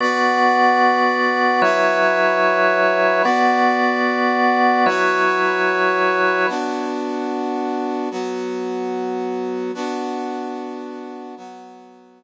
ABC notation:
X:1
M:3/4
L:1/8
Q:1/4=111
K:Bdor
V:1 name="Brass Section"
[Bdf]6 | [FBce]6 | [B,Fd]6 | [FBce]6 |
[B,DF]6 | [F,B,F]6 | [B,DF]6 | [F,B,F]6 |]
V:2 name="Drawbar Organ"
[B,Fd]6 | [F,EBc]6 | [B,Fd]6 | [F,EBc]6 |
z6 | z6 | z6 | z6 |]